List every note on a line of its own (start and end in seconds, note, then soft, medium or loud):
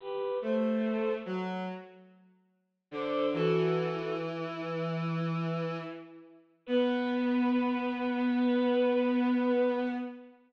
0.00 0.38 G4 medium
0.00 0.38 B4 medium
0.42 1.10 A3 medium
0.42 1.11 A4 medium
0.42 1.11 C5 medium
1.26 1.63 F#3 medium
2.91 3.28 D3 medium
2.91 3.27 A4 medium
2.91 3.27 C5 medium
3.33 5.77 E3 medium
3.33 4.13 F#4 medium
3.33 4.13 A4 medium
6.66 9.86 B3 loud
6.66 9.84 B4 loud